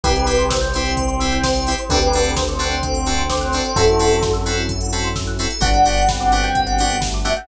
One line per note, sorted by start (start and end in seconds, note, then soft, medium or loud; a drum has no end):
0.03 1.75 C2 loud
0.03 0.25 C4 medium
0.03 1.88 C4 medium
0.03 0.12 C4 medium
0.03 1.88 E4 medium
0.03 0.12 E4 medium
0.03 0.49 G4 medium
0.03 1.88 G4 medium
0.03 0.12 G4 loud
0.03 0.49 B4 loud
0.03 0.14 C5 medium
0.03 kick loud
0.03 closed hi-hat loud
0.16 0.26 E5 medium
0.16 closed hi-hat medium
0.26 0.42 C4 medium
0.26 0.42 E4 medium
0.26 0.42 G4 medium
0.26 0.37 G5 medium
0.26 open hi-hat medium
0.38 0.49 C6 medium
0.38 closed hi-hat medium
0.50 1.30 C5 medium
0.50 0.60 E6 medium
0.50 kick medium
0.50 snare loud
0.61 0.72 G6 medium
0.61 closed hi-hat medium
0.73 0.91 C4 medium
0.73 1.71 C4 medium
0.73 0.91 E4 medium
0.73 0.91 G4 medium
0.73 0.84 C5 medium
0.73 open hi-hat medium
0.85 0.96 E5 medium
0.85 closed hi-hat medium
0.97 1.07 G5 medium
0.97 kick medium
0.97 closed hi-hat medium
1.08 1.19 C6 medium
1.08 closed hi-hat medium
1.20 1.37 C4 medium
1.20 1.37 E4 medium
1.20 1.37 G4 medium
1.20 1.30 E6 medium
1.20 open hi-hat medium
1.32 1.43 G6 medium
1.32 closed hi-hat medium
1.44 1.83 C5 medium
1.44 1.55 C5 medium
1.44 kick medium
1.44 snare loud
1.55 1.65 E5 medium
1.55 closed hi-hat medium
1.67 1.76 C4 medium
1.67 1.76 E4 medium
1.67 1.76 G4 medium
1.67 1.77 G5 medium
1.67 open hi-hat medium
1.78 1.90 C6 medium
1.78 closed hi-hat medium
1.89 3.61 D2 medium
1.89 3.74 C4 medium
1.89 2.10 C4 medium
1.89 1.99 C4 medium
1.89 3.74 D4 medium
1.89 1.99 D4 loud
1.89 3.74 F#4 medium
1.89 1.99 F#4 medium
1.89 2.33 G4 medium
1.89 3.74 A4 medium
1.89 1.99 A4 loud
1.89 2.33 B4 medium
1.89 2.00 C5 loud
1.89 kick loud
1.89 closed hi-hat loud
2.02 2.12 D5 medium
2.02 closed hi-hat medium
2.13 2.31 C4 medium
2.13 2.31 D4 medium
2.13 2.31 F#4 medium
2.13 2.31 A4 medium
2.13 2.24 F#5 medium
2.13 open hi-hat medium
2.25 2.35 A5 medium
2.25 closed hi-hat medium
2.37 3.22 C5 medium
2.37 2.47 C6 medium
2.37 kick medium
2.37 snare loud
2.48 2.59 D6 medium
2.48 closed hi-hat medium
2.59 2.75 C4 medium
2.59 3.74 C4 medium
2.59 2.75 D4 medium
2.59 2.75 F#4 medium
2.59 2.75 A4 medium
2.59 2.71 F#6 medium
2.59 open hi-hat medium
2.71 2.82 C5 medium
2.71 closed hi-hat medium
2.83 2.94 D5 medium
2.83 kick medium
2.83 closed hi-hat loud
2.94 3.05 F#5 medium
2.94 closed hi-hat medium
3.06 3.23 C4 medium
3.06 3.23 D4 medium
3.06 3.23 F#4 medium
3.06 3.23 A4 medium
3.06 3.17 A5 medium
3.06 open hi-hat medium
3.18 3.28 C6 medium
3.18 closed hi-hat medium
3.30 3.75 C5 medium
3.30 3.40 D6 medium
3.30 kick medium
3.30 snare loud
3.41 3.51 F#6 medium
3.41 closed hi-hat medium
3.52 3.62 C4 medium
3.52 3.62 D4 medium
3.52 3.62 F#4 medium
3.52 3.62 A4 medium
3.52 3.63 C5 medium
3.52 open hi-hat medium
3.64 3.74 D5 medium
3.64 closed hi-hat medium
3.76 5.47 F#2 loud
3.76 5.60 C4 medium
3.76 3.84 C4 medium
3.76 5.60 E4 medium
3.76 3.84 E4 loud
3.76 4.19 E4 medium
3.76 5.60 F#4 medium
3.76 4.32 F#4 medium
3.76 3.84 F#4 medium
3.76 5.60 A4 medium
3.76 4.32 A4 medium
3.76 3.84 A4 medium
3.76 3.87 C5 medium
3.76 kick loud
3.76 closed hi-hat loud
3.87 3.98 E5 medium
3.87 closed hi-hat medium
3.99 4.16 C4 medium
3.99 4.16 E4 medium
3.99 4.16 F#4 medium
3.99 4.16 A4 medium
3.99 4.10 F#5 medium
3.99 open hi-hat medium
4.11 4.21 A5 medium
4.11 closed hi-hat medium
4.22 4.33 C6 loud
4.22 kick medium
4.22 snare medium
4.33 4.44 E6 medium
4.33 closed hi-hat medium
4.46 4.62 C4 medium
4.46 4.62 E4 medium
4.46 4.62 F#4 medium
4.46 4.62 A4 medium
4.46 4.56 F#6 medium
4.46 open hi-hat medium
4.57 4.67 C5 medium
4.57 closed hi-hat medium
4.69 4.80 E5 medium
4.69 kick medium
4.69 closed hi-hat medium
4.81 4.91 F#5 medium
4.81 closed hi-hat medium
4.92 5.09 C4 medium
4.92 5.09 E4 medium
4.92 5.09 F#4 medium
4.92 5.09 A4 medium
4.92 5.04 A5 medium
4.92 open hi-hat medium
5.04 5.15 C6 medium
5.04 closed hi-hat medium
5.16 5.26 E6 medium
5.16 kick medium
5.16 snare medium
5.27 5.38 F#6 medium
5.27 closed hi-hat medium
5.39 5.47 C4 medium
5.39 5.47 E4 medium
5.39 5.47 F#4 medium
5.39 5.47 A4 medium
5.39 5.49 C5 medium
5.39 open hi-hat medium
5.50 5.61 E5 medium
5.50 closed hi-hat medium
5.60 7.33 G1 loud
5.60 5.69 B3 medium
5.60 7.46 B3 medium
5.60 5.69 D4 medium
5.60 7.46 D4 medium
5.60 6.04 D4 medium
5.60 5.69 F#4 loud
5.60 7.46 F#4 medium
5.60 5.69 G4 medium
5.60 7.46 G4 medium
5.60 5.72 B4 medium
5.60 5.73 F#5 medium
5.60 kick loud
5.60 closed hi-hat loud
5.73 5.84 D5 medium
5.73 6.16 F#5 medium
5.73 closed hi-hat medium
5.85 6.01 B3 medium
5.85 6.01 D4 medium
5.85 6.01 F#4 medium
5.85 6.01 G4 medium
5.85 5.96 F#5 medium
5.85 open hi-hat medium
5.97 6.08 G5 medium
5.97 closed hi-hat medium
6.08 6.92 C4 medium
6.08 6.19 B5 medium
6.08 kick medium
6.08 snare loud
6.20 6.40 F#5 medium
6.20 6.31 D6 medium
6.20 closed hi-hat medium
6.32 6.48 B3 medium
6.32 6.48 D4 medium
6.32 6.48 F#4 medium
6.32 6.48 G4 medium
6.32 6.42 F#6 medium
6.32 open hi-hat medium
6.43 6.64 G5 medium
6.43 6.54 G6 medium
6.43 closed hi-hat medium
6.55 6.66 B4 medium
6.55 kick medium
6.55 closed hi-hat medium
6.67 6.77 D5 medium
6.67 6.87 F#5 medium
6.67 closed hi-hat medium
6.78 6.96 B3 medium
6.78 6.96 D4 medium
6.78 6.96 F#4 medium
6.78 6.96 G4 medium
6.78 6.88 F#5 medium
6.78 open hi-hat medium
6.90 7.00 G5 medium
6.90 closed hi-hat medium
7.01 7.39 A3 medium
7.01 7.11 B5 medium
7.01 kick medium
7.01 snare loud
7.13 7.25 D6 medium
7.13 closed hi-hat medium
7.25 7.33 B3 medium
7.25 7.33 D4 medium
7.25 7.33 F#4 medium
7.25 7.33 G4 medium
7.25 7.36 E5 medium
7.25 7.35 F#6 medium
7.25 open hi-hat medium
7.37 7.47 F#5 medium
7.37 7.47 G6 medium
7.37 closed hi-hat medium